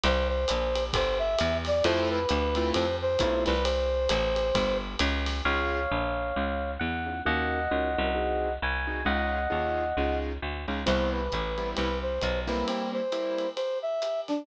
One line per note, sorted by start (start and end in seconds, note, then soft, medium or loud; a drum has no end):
0.04 0.45 C2 loud
0.04 0.28 C5 loud
0.04 ride loud
0.28 0.84 C5 loud
0.48 0.92 A#1 medium
0.48 hi-hat pedal loud
0.48 ride loud
0.75 ride loud
0.93 1.36 G1 loud
0.93 1.18 C5 loud
0.93 kick loud
0.93 ride loud
1.19 1.57 E5 loud
1.38 1.82 E2 loud
1.38 hi-hat pedal loud
1.38 ride loud
1.65 1.84 D5 loud
1.65 snare medium
1.65 ride loud
1.84 2.26 F2 loud
1.84 2.19 A3 loud
1.84 2.19 C4 loud
1.84 2.19 E4 loud
1.84 2.19 F4 loud
1.84 2.09 C5 loud
1.84 ride loud
2.10 2.70 B4 loud
2.29 2.72 D2 loud
2.29 hi-hat pedal loud
2.29 ride loud
2.55 2.85 A3 loud
2.55 2.85 C4 loud
2.55 2.85 E4 loud
2.55 2.85 F4 loud
2.55 ride loud
2.74 3.17 F2 medium
2.74 2.96 C5 loud
2.74 ride loud
3.02 3.44 C5 loud
3.19 3.46 B1 medium
3.19 3.53 A3 loud
3.19 3.53 C4 loud
3.19 3.53 E4 loud
3.19 3.53 F4 loud
3.19 kick medium
3.19 hi-hat pedal loud
3.19 ride loud
3.46 4.08 C2 loud
3.46 3.64 B4 loud
3.46 snare medium
3.46 ride loud
3.64 4.77 C5 loud
3.64 ride loud
4.09 4.52 A1 loud
4.09 hi-hat pedal loud
4.09 ride loud
4.36 ride loud
4.55 4.96 G1 medium
4.55 kick medium
4.55 ride loud
4.99 5.42 C#2 loud
4.99 hi-hat pedal loud
4.99 ride loud
5.26 snare medium
5.26 ride loud
5.45 5.87 C#2 medium
5.45 5.80 C#4 medium
5.45 5.80 D#4 medium
5.45 5.80 F4 medium
5.45 5.80 G#4 medium
5.45 6.71 C#5 medium
5.45 6.71 F5 medium
5.91 6.33 A#1 medium
6.36 6.78 C#2 medium
6.80 7.22 E2 medium
6.80 7.21 F#5 medium
7.06 7.19 C#4 medium
7.06 7.19 D#4 medium
7.06 7.19 F4 medium
7.06 7.19 G#4 medium
7.25 7.68 D#2 medium
7.25 7.59 C#4 medium
7.25 7.59 D#4 medium
7.25 7.59 F#4 medium
7.25 7.59 A#4 loud
7.25 8.53 D#5 medium
7.25 8.53 F#5 medium
7.71 7.96 C#2 medium
7.71 7.89 C#4 medium
7.71 7.89 D#4 medium
7.71 7.89 F#4 medium
7.71 7.89 A#4 medium
7.98 8.58 C2 medium
7.98 8.11 C#4 medium
7.98 8.11 D#4 medium
7.98 8.11 F#4 medium
7.98 8.11 A#4 medium
8.15 8.48 C4 medium
8.15 8.48 D#4 medium
8.15 8.48 F#4 medium
8.15 8.48 G#4 medium
8.62 9.04 C2 medium
8.62 9.04 G#5 medium
8.87 9.00 C4 medium
8.87 9.00 D#4 medium
8.87 9.00 F#4 medium
8.87 9.00 G#4 medium
9.05 9.47 C#2 medium
9.05 9.39 C#4 medium
9.05 9.39 D#4 medium
9.05 9.39 F4 medium
9.05 9.39 G#4 medium
9.05 10.17 D#5 medium
9.05 10.17 F#5 medium
9.50 9.93 D#2 medium
9.50 9.84 C#4 medium
9.50 9.84 D#4 medium
9.50 9.84 F4 medium
9.50 9.84 G#4 medium
9.97 10.38 C#2 medium
9.97 10.32 C#4 medium
9.97 10.32 D#4 medium
9.97 10.32 F4 medium
9.97 10.32 G#4 medium
10.42 10.66 D2 medium
10.68 10.85 C#2 medium
10.68 10.81 C#4 medium
10.68 10.81 D#4 medium
10.68 10.81 F4 medium
10.68 10.81 G#4 medium
10.86 11.29 C2 medium
10.86 11.20 G3 medium
10.86 11.20 B3 medium
10.86 11.20 C4 loud
10.86 11.20 E4 medium
10.86 11.10 C5 medium
10.86 crash loud
10.86 ride loud
11.12 11.69 B4 medium
11.32 11.74 A1 medium
11.32 kick medium
11.32 hi-hat pedal medium
11.32 ride medium
11.58 11.87 G3 medium
11.58 11.87 B3 medium
11.58 11.87 C4 medium
11.58 11.87 E4 medium
11.58 ride medium
11.76 12.19 C2 medium
11.76 11.98 B4 medium
11.76 ride loud
12.02 12.40 C5 medium
12.21 12.64 B1 medium
12.21 kick medium
12.21 hi-hat pedal loud
12.21 ride loud
12.47 13.00 G3 medium
12.47 13.00 A#3 medium
12.47 13.00 C4 medium
12.47 13.00 E4 medium
12.47 12.66 B4 medium
12.47 snare medium
12.47 ride medium
12.67 12.90 C4 medium
12.67 ride loud
12.93 13.49 C5 medium
13.12 13.46 G3 medium
13.12 13.46 A#3 medium
13.12 13.46 C4 medium
13.12 13.46 E4 medium
13.12 hi-hat pedal medium
13.12 ride medium
13.38 ride medium
13.56 13.78 C5 medium
13.56 ride loud
13.82 14.21 E5 medium
14.02 hi-hat pedal loud
14.02 ride medium
14.28 14.45 D4 medium
14.28 snare medium
14.28 ride medium